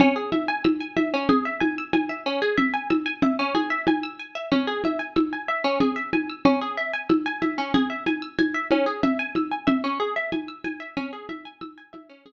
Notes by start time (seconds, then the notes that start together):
0.00 C#4, low conga
0.16 G#4
0.32 E5, high conga
0.48 G#5
0.64 E6, high conga
0.81 G#5
0.97 E5, high conga
1.14 C#4
1.29 G#4, low conga
1.45 E5
1.60 G#5, high conga
1.78 E6
1.93 G#5, high conga
2.09 E5
2.26 C#4
2.42 G#4
2.58 E5, low conga
2.74 G#5
2.90 E6, high conga
3.06 G#5
3.22 E5, low conga
3.39 C#4
3.55 G#4, high conga
3.70 E5
3.87 G#5, high conga
4.03 E6
4.19 G#5
4.35 E5
4.52 C#4, low conga
4.67 G#4
4.84 E5, high conga
4.99 G#5
5.16 E6, high conga
5.33 G#5
5.48 E5
5.64 C#4
5.80 G#4, low conga
5.96 E5
6.13 G#5, high conga
6.30 E6
6.45 C#4, low conga
6.61 G#4
6.77 E5
6.93 G#5
7.09 E6, high conga
7.26 G#5
7.42 E5, high conga
7.58 C#4
7.74 G#4, low conga
7.90 E5
8.06 G#5, high conga
8.22 E6
8.39 G#5, high conga
8.54 E5
8.71 C#4, high conga
8.86 G#4
9.03 E5, low conga
9.19 G#5
9.35 E6, high conga
9.51 G#5
9.67 E5, low conga
9.84 C#4
10.00 G#4
10.16 E5
10.32 G#5, high conga
10.48 E6
10.64 G#5, high conga
10.80 E5
10.97 C#4, low conga
11.13 G#4
11.29 E5, high conga
11.45 G#5
11.61 E6, high conga
11.78 G#5
11.93 E5, high conga
12.10 C#4
12.26 G#4, low conga